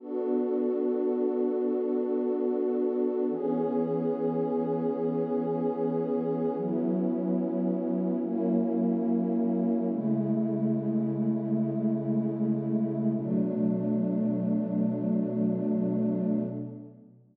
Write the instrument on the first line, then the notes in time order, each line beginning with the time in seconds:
pad 2 (warm)
0.00 B3 D4 F#4 A4
3.30 E3 B3 C#4 G#4
6.56 F#3 B3 C#4 E4
8.22 F#3 A#3 C#4 E4
9.87 C#3 G#3 A3 E4
13.15 B2 F#3 A3 D4